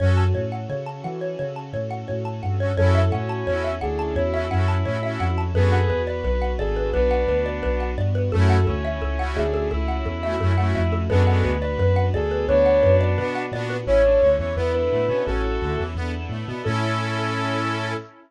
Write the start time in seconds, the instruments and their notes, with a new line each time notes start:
0.00 synth bass 2 F#2, accordion C#4 F#4, string ensemble 1 C#4 F#4 A4, xylophone C#5
0.05 accordion A4
0.17 xylophone A5
0.35 synth bass 2 A2, xylophone C#5
0.52 xylophone F#5
0.69 synth bass 2 C#3, xylophone C#5
0.86 xylophone A5
1.04 synth bass 2 E3, xylophone F#5
1.21 xylophone C#5
1.39 synth bass 2 C#3, xylophone C#5
1.56 xylophone A5
1.73 synth bass 2 A2, xylophone C#5
1.91 xylophone F#5
2.08 synth bass 2 A2, xylophone C#5
2.25 xylophone A5
2.43 synth bass 2 G2, xylophone F#5
2.60 accordion C#4 F#4, xylophone C#5
2.65 accordion A4
2.77 synth bass 2 F#2, string ensemble 1 C#4 E4 F#4 A4, accordion C#4 E4, ocarina A4, xylophone C#5
2.83 accordion F#4 A4
2.95 xylophone E5
3.11 synth bass 2 A2, lead 1 (square) C#4, xylophone F#5
3.29 xylophone A5
3.47 synth bass 2 E2, accordion C#4 E4, xylophone C#5
3.52 accordion F#4 A4
3.64 xylophone E5
3.81 synth bass 2 D2, lead 1 (square) D4, ocarina G#4, xylophone F#5
3.99 xylophone A5
4.16 synth bass 2 E2, lead 1 (square) E4, xylophone C#5
4.33 accordion C#4 E4, xylophone E5
4.38 accordion F#4 A4
4.51 synth bass 2 F#2, accordion C#4 E4, xylophone F#5
4.56 accordion F#4 A4
4.68 xylophone A5
4.85 synth bass 2 A2, accordion C#4 E4, xylophone C#5
4.90 accordion F#4 A4
5.03 accordion C#4 E4, xylophone E5
5.08 accordion F#4 A4
5.20 synth bass 2 F2, xylophone F#5
5.38 xylophone A5
5.54 synth bass 2 F#2, accordion B3 D4, string ensemble 1 B3 D4 F#4, lead 1 (square) G#4 B4, ocarina A4, xylophone B4
5.59 accordion F#4
5.72 xylophone F#5
5.90 synth bass 2 E2, xylophone B4
6.07 lead 1 (square) B4, xylophone D5
6.24 synth bass 2 B1, xylophone B4
6.42 xylophone F#5
6.58 synth bass 2 G#1, ocarina G#4, lead 1 (square) A4, xylophone D5
6.76 xylophone B4
6.93 synth bass 2 B1, lead 1 (square) B3 D4, xylophone B4, ocarina B4
7.11 xylophone F#5
7.27 synth bass 2 D2, xylophone B4
7.46 xylophone D5
7.63 synth bass 2 B1, xylophone B4
7.80 xylophone F#5
7.97 synth bass 2 G2, xylophone D5
8.15 xylophone B4
8.32 synth bass 2 F#2, string ensemble 1 A3 C#4 E4 F#4, accordion A3 C#4, xylophone A4, ocarina A4
8.38 accordion E4 F#4
8.50 xylophone F#5
8.67 synth bass 2 D2, lead 1 (square) C#4, xylophone A4
8.85 xylophone E5
9.02 synth bass 2 C#2, xylophone A4
9.19 accordion A3 C#4, xylophone F#5
9.24 accordion E4 F#4
9.36 synth bass 2 D2, lead 1 (square) D4, ocarina G#4, xylophone E5
9.54 xylophone A4
9.71 synth bass 2 C#2, lead 1 (square) E4, xylophone A4
9.88 xylophone F#5
10.05 synth bass 2 E2, xylophone A4
10.23 accordion A3 C#4, xylophone E5
10.28 accordion E4 F#4
10.40 synth bass 2 F#2, accordion A3 C#4, xylophone A4
10.46 accordion E4 F#4
10.58 accordion A3 C#4, xylophone F#5
10.63 accordion E4 F#4
10.75 synth bass 2 F2, xylophone E5
10.92 xylophone A4
11.09 synth bass 2 F#2, lead 1 (square) G#3 B3, string ensemble 1 B3 D4 F#4, accordion B3 D4, ocarina A4, xylophone B4
11.15 accordion F#4
11.27 accordion B3 D4, xylophone F#5
11.32 accordion F#4
11.44 synth bass 2 D2, xylophone B4
11.60 lead 1 (square) B4, xylophone D5
11.78 synth bass 2 F#2, xylophone B4
11.96 xylophone F#5
12.13 synth bass 2 D2, ocarina G#4, lead 1 (square) A4, xylophone D5
12.31 xylophone B4
12.48 synth bass 2 D2, lead 1 (square) B3 D4, xylophone B4, ocarina C#5
12.66 xylophone F#5
12.83 synth bass 2 F#2, xylophone B4
13.01 xylophone D5
13.18 synth bass 2 B2, accordion B3 D4, xylophone B4
13.23 accordion F#4
13.35 xylophone F#5
13.52 synth bass 2 A#2, accordion B3 D4, xylophone D5
13.58 accordion F#4
13.70 xylophone B4
13.86 synth bass 2 A1, accordion C#4, string ensemble 1 C#4 E4 A4, lead 1 (square) E4, ocarina C#5
14.05 lead 1 (square) D4
14.22 synth bass 2 D2, accordion D3, lead 1 (square) C#5
14.39 synth bass 2 E2, accordion E3, lead 1 (square) C#5
14.56 synth bass 2 E2, accordion B3, string ensemble 1 B3 D4 E4 A4, lead 1 (square) E4, ocarina B4
14.74 ocarina B4
14.91 synth bass 2 A2, accordion A3
15.08 synth bass 2 B2, accordion B3, lead 1 (square) C#4
15.26 synth bass 2 A1, accordion C#4, string ensemble 1 C#4 E4 A4, lead 1 (square) F#4 A4, ocarina A4
15.61 synth bass 2 D2, accordion D3
15.78 synth bass 2 E2, accordion E3
15.95 synth bass 2 E2, string ensemble 1 B3 D4 E4 A4, accordion B3
16.29 synth bass 2 A2, accordion A3
16.47 synth bass 2 B2, accordion B3
16.63 synth bass 2 A2, string ensemble 1 C#4 E4 A4, accordion C#4, lead 1 (square) A4, ocarina A4
16.67 accordion E4 A4